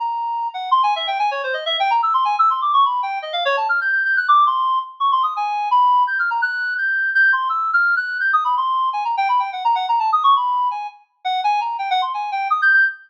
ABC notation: X:1
M:3/4
L:1/8
Q:1/4=168
K:none
V:1 name="Clarinet"
^a3 ^f (3c' ^g e | (3g ^g ^c (3=c ^d e (3=g ^a e' | (3c' ^g e' (3c' d' ^c' b =g | (3^d f ^c (3a f' g' (3g' g' ^f' |
d' c'2 z (3^c' =c' ^d' | ^g2 b2 (3=g' f' ^a | ^f'2 g'2 g' c' | (3e'2 f'2 ^f'2 (3g' ^d' b |
c'2 (3^g ^a =g (3b g ^f | (3^a ^f a (3=a ^d' ^c' b2 | ^g z2 ^f g ^a | (3g ^f c' ^g =g (3^d' g' g' |]